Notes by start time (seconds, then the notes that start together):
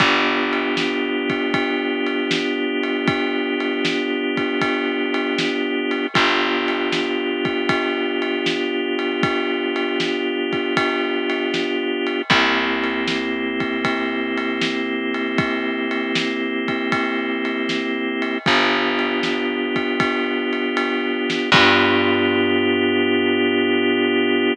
0.00 G1 B3 D4 F4 G4, kick, ride
0.53 ride
0.77 snare
1.30 kick, ride
1.54 kick, ride
2.07 ride
2.31 snare
2.83 ride
3.08 kick, ride
3.60 ride
3.85 snare
4.37 kick, ride
4.61 kick, ride
5.14 ride
5.38 snare
5.91 ride
6.14 G1 B3 D4 F4 G4, kick, ride
6.68 ride
6.92 snare
7.45 kick, ride
7.69 kick, ride
8.22 ride
8.46 snare
8.99 ride
9.23 kick, ride
9.76 ride
10.00 snare
10.53 kick, ride
10.77 kick, ride
11.30 ride
11.54 snare
12.07 ride
12.30 C2 A#3 C4 E4 G4, kick, ride
12.84 ride
13.08 snare
13.60 kick, ride
13.85 kick, ride
14.38 ride
14.62 snare
15.14 ride
15.38 kick, ride
15.91 ride
16.15 snare
16.68 kick, ride
16.92 kick, ride
17.45 ride
17.69 snare
18.22 ride
18.46 G1 B3 D4 F4 G4, kick, ride
18.99 ride
19.23 snare
19.76 kick, ride
20.00 kick, ride
20.53 ride
20.77 ride
21.30 snare
21.52 G2 B3 D4 F4 G4, kick, crash